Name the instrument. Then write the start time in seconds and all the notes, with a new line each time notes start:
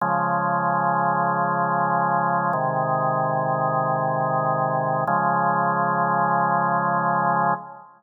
drawbar organ
0.01 C#3 F3 G#3
2.53 C3 D#3 G#3
5.07 C#3 F3 G#3